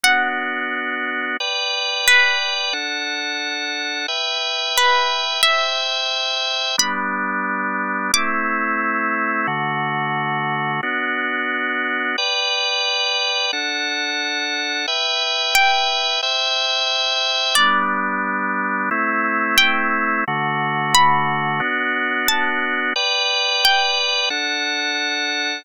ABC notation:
X:1
M:2/4
L:1/8
Q:1/4=89
K:G
V:1 name="Pizzicato Strings"
f4 | z2 B2 | z4 | z2 B2 |
e4 | b4 | d'4 | z4 |
z4 | z4 | z4 | z2 g2 |
z4 | d4 | z2 g2 | z2 b2 |
z2 a2 | z2 g2 | z4 |]
V:2 name="Drawbar Organ"
[B,DF]4 | [Bdg]4 | [DAf]4 | [Beg]4 |
[ceg]4 | [G,B,D]4 | [A,CE]4 | [D,A,F]4 |
[B,DF]4 | [Bdg]4 | [DAf]4 | [Beg]4 |
[ceg]4 | [G,B,D]4 | [A,CE]4 | [D,A,F]4 |
[B,DF]4 | [Bdg]4 | [DAf]4 |]